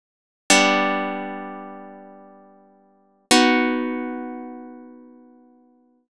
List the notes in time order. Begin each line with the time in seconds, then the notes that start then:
0.50 G3 B3 D4
3.31 B3 D#4 F#4